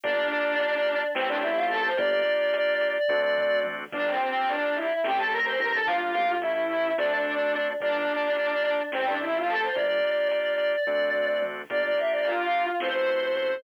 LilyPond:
<<
  \new Staff \with { instrumentName = "Choir Aahs" } { \time 7/8 \key g \dorian \tempo 4 = 108 d'2 c'16 d'16 e'16 f'16 a'16 c''16 | d''4 d''8. d''4~ d''16 r8 | d'16 c'16 c'16 c'16 d'8 e'8 g'16 a'16 bes'16 c''16 bes'16 a'16 | f'4 e'4 d'4. |
d'2 c'16 d'16 e'16 f'16 a'16 c''16 | d''4 d''8. d''4~ d''16 r8 | d''16 d''16 e''16 d''16 f'4 c''4. | }
  \new Staff \with { instrumentName = "Drawbar Organ" } { \time 7/8 \key g \dorian <bes d' f' g'>2 <a c' e' g'>4. | <bes d' f' g'>2 <a c' d' fis'>4. | <bes d' f' g'>2 <a c' e' g'>4. | <bes d' f' g'>4 <a cis' e' g'>4 <a c' d' fis'>4. |
<bes d' f' g'>2 <a c' e' g'>4. | <bes d' f' g'>2 <a c' d' fis'>4. | <bes d' f' g'>2 <a c' e' fis'>4. | }
  \new Staff \with { instrumentName = "Synth Bass 1" } { \clef bass \time 7/8 \key g \dorian g,,2 a,,4. | g,,2 d,4. | g,,2 a,,4 g,,8~ | g,,8 a,,4. d,4. |
g,,2 a,,4. | g,,2 d,4. | g,,2 a,,4. | }
  \new DrumStaff \with { instrumentName = "Drums" } \drummode { \time 7/8 <hh bd>8 hh8 hh8 hh8 sn8 hh8 hh8 | <hh bd>8 hh8 hh8 hh8 <bd tomfh>8 toml8 tommh8 | <cymc bd>8 hh8 hh8 hh8 sn8 hh8 hh8 | bd8 hh8 hh8 hh8 sn8 hh8 hh8 |
<hh bd>8 hh8 hh8 hh8 sn8 hh8 hh8 | <hh bd>8 hh8 hh8 hh8 <bd tomfh>8 toml8 tommh8 | <hh bd>8 hh8 hh8 hh8 sn8 hh8 hh8 | }
>>